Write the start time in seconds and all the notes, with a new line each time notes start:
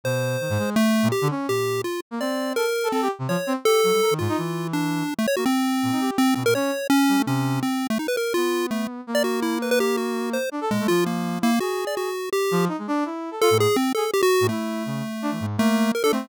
0.04 B2 C5
0.41 D#3
0.50 G#2
0.59 G#3
0.76 A3
1.03 A#2
1.12 G4
1.21 D3
1.30 C#4
1.48 A#2 G4
1.84 F4
2.11 A#3
2.20 C4 D5
2.56 A4 A#4
2.84 A4
2.92 C4 A4
3.02 G4
3.19 C3
3.28 F3 C#5
3.47 C4
3.65 G4 A4
3.84 F#3
3.93 G3
4.02 A#4
4.11 D#3
4.19 G#2 F4
4.29 D#4
4.38 E3
4.73 D4
5.19 A3
5.27 C#5
5.37 A#3 F#4
5.46 C4
5.83 A#2
5.92 D#4
6.01 G4
6.18 C4
6.35 B2 C4
6.45 A#2 A#4
6.55 C#4 C#5
6.90 C#4
7.08 G3
7.17 A3
7.26 C3 C#4
7.63 C4
7.90 A3
7.99 D#4
8.08 B4
8.17 A#4
8.34 B3 F4
8.71 A3
9.07 A#3
9.15 D5
9.24 F#4
9.42 E4
9.62 B4
9.71 B4
9.80 G4
9.97 F#4
10.33 C5
10.52 D4
10.61 A4
10.70 A#2 G#3
10.80 A3
10.88 F3 F4
11.06 A#3
11.41 A#3 E4
11.60 F#4 G#4
11.87 D5
11.97 F#4
12.33 G4
12.51 F3
12.68 D#4
12.78 G#3
12.88 D4
13.05 E4
13.31 A4
13.41 F4 A4
13.50 A2
13.60 G#4
13.76 C4
13.95 G#4 A4
14.13 G4
14.23 F#4
14.41 A2
14.49 A3 E4
14.86 C#3
15.22 D4
15.31 E3
15.40 G#2
15.58 A3 A#3
15.95 A#4
16.03 D4 A4
16.12 A3 C4